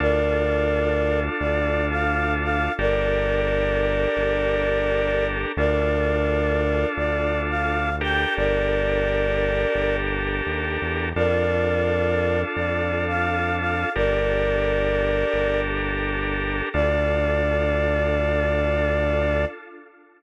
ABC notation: X:1
M:4/4
L:1/16
Q:1/4=86
K:Dm
V:1 name="Choir Aahs"
[Bd]8 d3 f3 f2 | [Bd]16 | [Bd]8 d3 f3 g2 | [Bd]10 z6 |
[Bd]8 d3 f3 f2 | [Bd]10 z6 | d16 |]
V:2 name="Drawbar Organ"
[DFA]16 | [DGAB]16 | [DFA]14 [DGAB]2- | [DGAB]16 |
[DFA]16 | [DGAB]16 | [DFA]16 |]
V:3 name="Synth Bass 1" clef=bass
D,,8 D,,8 | G,,,8 G,,,8 | D,,8 D,,8 | G,,,8 G,,,4 _E,,2 =E,,2 |
F,,8 F,,8 | G,,,8 G,,,8 | D,,16 |]